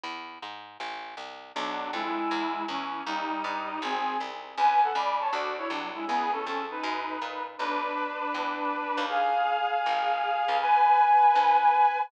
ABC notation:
X:1
M:4/4
L:1/8
Q:"Swing" 1/4=159
K:Bdor
V:1 name="Clarinet"
z8 | [F,D]2 [G,E]4 [E,C]2 | [=G,^D]4 [^B,^G]2 z2 | [Bg] [Af] [db] [ca] [Fd] [Ec] [F,D] [G,E] |
[B,G] [CA]2 [^DB]4 z | [DB]8 | [G^e]8 | [Bg]8 |]
V:2 name="Electric Bass (finger)" clef=bass
E,,2 G,,2 A,,,2 =C,,2 | B,,,2 =F,,2 E,,2 E,,2 | ^D,,2 =G,,2 ^G,,,2 ^B,,,2 | C,,2 C,,2 D,,2 =C,,2 |
C,,2 ^E,,2 F,,2 ^A,,2 | B,,,4 E,,3 ^D,,- | ^D,,4 G,,,3 C,,- | C,,4 D,,4 |]